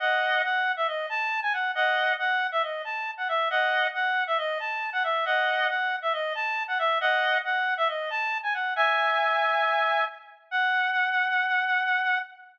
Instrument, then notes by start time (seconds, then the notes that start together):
clarinet
0.00 D#5 F#5
0.44 F#5
0.77 E5
0.88 D#5
1.09 A5
1.42 G#5
1.53 F#5
1.75 D#5 F#5
2.19 F#5
2.52 E5
2.63 D#5
2.85 A5
3.18 F#5
3.28 E5
3.50 D#5 F#5
3.94 F#5
4.27 E5
4.38 D#5
4.60 A5
4.93 F#5
5.04 E5
5.25 D#5 F#5
5.69 F#5
6.02 E5
6.13 D#5
6.35 A5
6.68 F#5
6.79 E5
7.01 D#5 F#5
7.45 F#5
7.77 E5
7.88 D#5
8.10 A5
8.43 G#5
8.54 F#5
8.76 E5 G#5
10.51 F#5